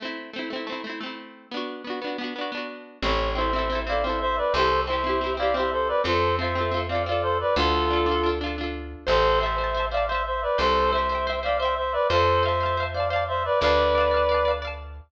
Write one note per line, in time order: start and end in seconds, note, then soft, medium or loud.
0.00 0.31 A3 medium
0.00 0.31 C4 loud
0.05 0.31 E4 loud
0.33 0.49 A3 medium
0.33 0.49 C4 medium
0.39 0.49 E4 medium
0.50 0.66 A3 medium
0.50 0.66 C4 medium
0.56 0.66 E4 medium
0.67 0.82 A3 medium
0.67 0.82 C4 medium
0.72 0.82 E4 medium
0.84 1.00 A3 medium
0.84 1.00 C4 medium
0.89 1.00 E4 medium
1.01 1.47 A3 medium
1.01 1.47 C4 medium
1.06 1.47 E4 medium
1.51 1.82 B3 medium
1.51 1.82 D4 medium
1.57 1.82 F#4 medium
1.84 2.00 B3 medium
1.84 2.00 D4 medium
1.90 2.00 F#4 medium
2.02 2.17 B3 medium
2.02 2.17 D4 medium
2.07 2.17 F#4 medium
2.18 2.34 B3 medium
2.18 2.34 D4 medium
2.24 2.34 F#4 medium
2.36 2.51 B3 medium
2.36 2.51 D4 medium
2.41 2.51 F#4 medium
2.52 2.98 B3 medium
2.52 2.98 D4 medium
2.57 2.98 F#4 medium
3.02 4.42 A1 medium
3.02 3.33 C4 loud
3.02 3.33 E4 loud
3.02 3.31 C#5 medium
3.08 3.33 A4 loud
3.35 3.51 C4 medium
3.35 3.51 E4 medium
3.35 3.79 C5 medium
3.35 3.79 E5 medium
3.41 3.51 A4 medium
3.53 3.69 C4 medium
3.53 3.69 E4 loud
3.59 3.69 A4 loud
3.70 3.85 C4 medium
3.70 3.85 E4 medium
3.75 3.85 A4 medium
3.87 4.02 C4 medium
3.87 4.02 E4 medium
3.87 4.04 D5 medium
3.87 4.04 F5 medium
3.92 4.02 A4 medium
4.03 4.50 C4 medium
4.03 4.50 E4 medium
4.03 4.19 C5 medium
4.03 4.19 E5 medium
4.10 4.50 A4 medium
4.20 4.36 C5 medium
4.20 4.36 E5 medium
4.37 4.53 B4 medium
4.37 4.53 D5 medium
4.54 5.93 C2 medium
4.54 4.85 C4 loud
4.54 4.85 E4 loud
4.54 4.81 A4 medium
4.54 4.81 C5 medium
4.59 4.85 G4 loud
4.87 5.03 C4 medium
4.87 5.03 E4 medium
4.87 5.33 C5 medium
4.87 5.33 E5 medium
4.93 5.03 G4 medium
5.04 5.19 C4 medium
5.04 5.19 E4 medium
5.09 5.19 G4 medium
5.21 5.36 C4 medium
5.21 5.36 E4 medium
5.26 5.36 G4 medium
5.37 5.53 C4 medium
5.37 5.53 E4 loud
5.37 5.55 D5 medium
5.37 5.55 F5 medium
5.43 5.53 G4 medium
5.54 6.01 C4 medium
5.54 6.01 E4 medium
5.54 5.70 C5 medium
5.54 5.70 E5 medium
5.60 6.01 G4 loud
5.72 5.88 A4 medium
5.72 5.88 C5 medium
5.88 6.01 B4 medium
5.88 6.01 D5 medium
6.04 7.44 F2 medium
6.04 6.35 C4 loud
6.04 6.35 F4 medium
6.04 6.35 A4 medium
6.04 6.35 C5 medium
6.10 6.35 A4 loud
6.39 6.54 C4 medium
6.39 6.54 F4 medium
6.39 6.80 C5 medium
6.39 6.80 E5 medium
6.44 6.54 A4 medium
6.55 6.71 C4 medium
6.55 6.71 F4 medium
6.61 6.71 A4 medium
6.71 6.87 C4 medium
6.71 6.87 F4 medium
6.77 6.87 A4 medium
6.89 7.05 C4 medium
6.89 7.05 F4 medium
6.89 7.03 D5 medium
6.89 7.03 F5 medium
6.95 7.05 A4 medium
7.06 7.53 C4 medium
7.06 7.53 F4 medium
7.06 7.22 D5 medium
7.06 7.22 F5 medium
7.12 7.53 A4 loud
7.22 7.38 A4 medium
7.22 7.38 C5 medium
7.40 7.55 B4 medium
7.40 7.55 D5 medium
7.56 8.95 D2 medium
7.56 7.88 D4 medium
7.56 8.28 F4 medium
7.56 7.88 F4 loud
7.56 8.28 A4 medium
7.62 7.88 A4 loud
7.90 8.06 D4 medium
7.90 8.06 F4 medium
7.96 8.06 A4 medium
8.06 8.21 D4 medium
8.06 8.21 F4 medium
8.11 8.21 A4 medium
8.23 8.39 D4 medium
8.23 8.39 F4 medium
8.29 8.39 A4 medium
8.41 8.56 D4 medium
8.41 8.56 F4 medium
8.46 8.56 A4 medium
8.58 9.04 D4 medium
8.58 9.04 F4 loud
8.64 9.04 A4 medium
9.07 10.47 A1 medium
9.07 9.39 A4 medium
9.07 9.38 C5 loud
9.07 9.39 C5 medium
9.07 9.38 E5 loud
9.12 9.38 A5 medium
9.40 9.86 C5 medium
9.40 9.56 C5 loud
9.40 9.86 E5 medium
9.40 9.56 E5 loud
9.46 9.56 A5 medium
9.58 9.74 C5 medium
9.58 9.74 E5 medium
9.64 9.74 A5 medium
9.75 9.90 C5 medium
9.75 9.90 E5 loud
9.80 9.90 A5 medium
9.91 10.07 C5 medium
9.91 10.05 D5 medium
9.91 10.07 E5 medium
9.91 10.05 F5 medium
9.97 10.07 A5 loud
10.07 10.23 C5 medium
10.07 10.56 C5 loud
10.07 10.23 E5 medium
10.12 10.56 E5 loud
10.12 10.56 A5 medium
10.25 10.42 C5 medium
10.25 10.42 E5 medium
10.42 10.58 B4 medium
10.42 10.58 D5 medium
10.58 11.98 C2 medium
10.58 10.91 A4 medium
10.58 10.89 C5 loud
10.58 10.91 C5 medium
10.58 10.89 E5 loud
10.64 10.89 G5 loud
10.93 11.39 C5 medium
10.93 11.08 C5 medium
10.93 11.39 E5 medium
10.93 11.08 E5 medium
10.98 11.08 G5 medium
11.09 11.25 C5 medium
11.09 11.25 E5 medium
11.15 11.25 G5 medium
11.27 11.42 C5 loud
11.27 11.42 E5 loud
11.32 11.42 G5 medium
11.43 11.58 C5 medium
11.43 11.57 D5 medium
11.43 11.58 E5 medium
11.43 11.57 F5 medium
11.48 11.58 G5 medium
11.60 11.75 C5 medium
11.60 12.06 C5 medium
11.60 11.75 E5 medium
11.60 12.06 E5 loud
11.65 12.06 G5 medium
11.77 11.93 C5 medium
11.77 11.93 E5 medium
11.92 12.07 B4 medium
11.92 12.07 D5 medium
12.10 13.49 F2 medium
12.10 12.43 A4 medium
12.10 12.41 C5 loud
12.10 12.43 C5 medium
12.10 12.41 F5 loud
12.15 12.41 A5 loud
12.43 12.58 C5 medium
12.43 12.84 C5 medium
12.43 12.84 E5 medium
12.43 12.58 F5 medium
12.48 12.58 A5 medium
12.60 12.76 C5 medium
12.60 12.76 F5 medium
12.66 12.76 A5 medium
12.77 12.93 C5 medium
12.77 12.93 F5 medium
12.83 12.93 A5 medium
12.94 13.10 C5 medium
12.94 13.08 D5 medium
12.94 13.08 F5 medium
12.94 13.10 F5 loud
13.00 13.10 A5 medium
13.10 13.57 C5 loud
13.10 13.24 D5 medium
13.10 13.24 F5 medium
13.10 13.57 F5 medium
13.16 13.57 A5 medium
13.28 13.43 C5 medium
13.28 13.43 E5 medium
13.45 13.59 B4 medium
13.45 13.59 D5 medium
13.61 15.01 D2 medium
13.61 14.52 B4 medium
13.61 14.52 D5 medium
13.61 13.92 D5 loud
13.61 13.92 F5 loud
13.66 13.92 A5 loud
13.95 14.10 D5 medium
13.95 14.10 F5 loud
14.00 14.10 A5 medium
14.11 14.27 D5 medium
14.11 14.27 F5 medium
14.17 14.27 A5 medium
14.29 14.44 D5 medium
14.29 14.44 F5 medium
14.34 14.44 A5 medium
14.45 14.61 D5 medium
14.45 14.61 F5 medium
14.51 14.61 A5 medium
14.62 15.08 D5 loud
14.62 15.08 F5 medium
14.67 15.08 A5 loud